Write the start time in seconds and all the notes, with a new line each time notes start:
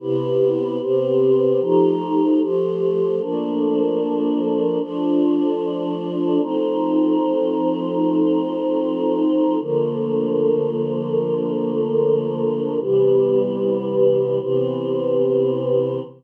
0.00 C3 B3 E4 G4
0.80 C3 B3 C4 G4
1.60 F3 A3 D#4 G4
2.40 F3 A3 F4 G4
3.20 F3 A3 A#3 D4
4.80 F3 A3 D4 F4
6.40 F3 A3 C4 D#4
9.60 D3 F3 A3 A#3
12.80 C3 E3 G3 B3
14.40 C3 E3 B3 C4